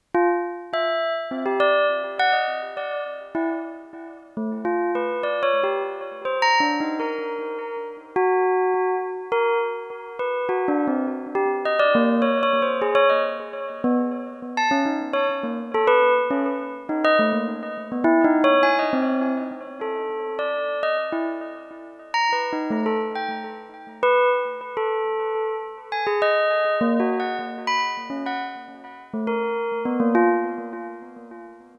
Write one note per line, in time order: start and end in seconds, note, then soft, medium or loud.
0.15 0.28 F4 loud
0.73 1.13 E5 medium
1.31 1.44 C4 medium
1.46 1.59 G4 medium
1.60 1.86 D5 loud
2.19 2.33 F#5 loud
2.33 2.59 D#5 medium
2.77 3.03 D5 medium
3.35 3.48 E4 medium
4.37 4.50 A3 medium
4.65 4.91 F4 medium
4.95 5.21 B4 medium
5.23 5.41 D5 medium
5.43 5.60 C#5 medium
5.63 5.81 G4 medium
6.25 6.38 C5 medium
6.42 6.60 A#5 loud
6.60 6.78 D4 medium
6.80 6.98 D#4 medium
7.00 7.78 A#4 medium
8.16 8.95 F#4 loud
9.32 9.58 A#4 loud
10.19 10.46 B4 medium
10.49 10.66 F#4 medium
10.68 10.86 D4 medium
10.87 11.05 C4 medium
11.35 11.48 G4 medium
11.65 11.79 D#5 medium
11.79 11.92 D5 loud
11.95 12.21 A#3 medium
12.22 12.39 C#5 medium
12.43 12.60 C#5 loud
12.62 12.80 C5 medium
12.82 12.95 G#4 medium
12.95 13.08 C#5 loud
13.09 13.23 D#5 medium
13.84 13.97 B3 loud
14.57 14.70 A5 medium
14.71 14.84 C#4 medium
14.86 14.99 D#4 medium
15.13 15.26 C#5 medium
15.43 15.57 A#3 medium
15.74 15.87 A4 loud
15.87 16.14 B4 loud
16.30 16.44 C#4 medium
16.89 17.02 D#4 medium
17.04 17.18 D#5 loud
17.19 17.32 A3 medium
17.33 17.46 A#3 soft
17.92 18.05 B3 medium
18.04 18.22 E4 loud
18.24 18.42 D#4 loud
18.44 18.62 C#5 loud
18.63 18.76 G#5 medium
18.79 18.92 D#5 medium
18.93 19.32 C4 medium
19.81 20.34 A4 medium
20.39 20.78 D5 medium
20.83 20.96 D#5 medium
21.12 21.25 E4 medium
22.14 22.31 A#5 medium
22.33 22.50 B4 medium
22.53 22.70 D#4 medium
22.71 22.84 A3 medium
22.86 22.99 A4 medium
23.15 23.29 G5 medium
24.03 24.29 B4 loud
24.77 25.55 A4 medium
25.92 26.05 G#5 medium
26.07 26.20 G#4 medium
26.22 26.74 D#5 loud
26.81 26.98 A#3 medium
27.00 27.17 F#4 medium
27.20 27.37 F#5 medium
27.67 27.80 B5 medium
28.10 28.23 C#4 soft
28.26 28.39 F#5 medium
29.14 29.27 A3 medium
29.27 29.80 A#4 medium
29.85 29.98 B3 medium
30.00 30.13 A#3 medium
30.15 30.28 F4 loud